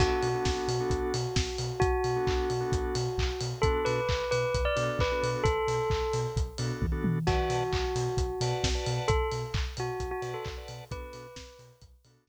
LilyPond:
<<
  \new Staff \with { instrumentName = "Tubular Bells" } { \time 4/4 \key b \phrygian \tempo 4 = 132 fis'1 | fis'1 | a'8 b'4 b'8. d''8 r16 b'8. r16 | a'2 r2 |
fis'1 | a'8 r4 fis'8. fis'8 a'16 r4 | b'4. r2 r8 | }
  \new Staff \with { instrumentName = "Drawbar Organ" } { \time 4/4 \key b \phrygian <b d' fis' a'>8. <b d' fis' a'>4 <b d' fis' a'>2~ <b d' fis' a'>16~ | <b d' fis' a'>8. <b d' fis' a'>4 <b d' fis' a'>2~ <b d' fis' a'>16 | <b d' fis' a'>2~ <b d' fis' a'>8 <b d' fis' a'>8. <b d' fis' a'>8.~ | <b d' fis' a'>2~ <b d' fis' a'>8 <b d' fis' a'>8. <b d' fis' a'>8. |
<b' d'' fis'' a''>2~ <b' d'' fis'' a''>8 <b' d'' fis'' a''>8. <b' d'' fis'' a''>8.~ | <b' d'' fis'' a''>2~ <b' d'' fis'' a''>8 <b' d'' fis'' a''>8. <b' d'' fis'' a''>8. | <b d' fis' a'>2~ <b d' fis' a'>8 <b d' fis' a'>8. r8. | }
  \new Staff \with { instrumentName = "Synth Bass 2" } { \clef bass \time 4/4 \key b \phrygian b,,8 b,8 b,,8 b,8 b,,8 b,8 b,,8 b,8 | b,,8 b,8 b,,8 b,8 b,,8 b,8 b,,8 b,8 | b,,8 b,8 b,,8 b,8 b,,8 b,8 b,,8 b,8 | b,,8 b,8 b,,8 b,8 b,,8 b,8 b,,8 b,8 |
b,,8 b,8 b,,8 b,8 b,,8 b,8 b,,8 b,8 | b,,8 b,8 b,,8 b,8 b,,8 b,8 b,,8 b,8 | b,,8 b,8 b,,8 b,8 b,,8 b,8 b,,8 r8 | }
  \new DrumStaff \with { instrumentName = "Drums" } \drummode { \time 4/4 <cymc bd>8 hho8 <bd sn>8 hho8 <hh bd>8 hho8 <bd sn>8 hho8 | <hh bd>8 hho8 <hc bd>8 hho8 <hh bd>8 hho8 <hc bd>8 hho8 | <hh bd>8 hho8 <hc bd>8 hho8 <hh bd>8 hho8 <hc bd>8 hho8 | <hh bd>8 hho8 <hc bd>8 hho8 <hh bd>8 hho8 <bd tommh>8 tommh8 |
<cymc bd>8 hho8 <hc bd>8 hho8 <hh bd>8 hho8 <bd sn>8 hho8 | <hh bd>8 hho8 <hc bd>8 hho8 <hh bd>8 hho8 <hc bd>8 hho8 | <hh bd>8 hho8 <bd sn>8 hho8 <hh bd>8 hho8 <bd sn>4 | }
>>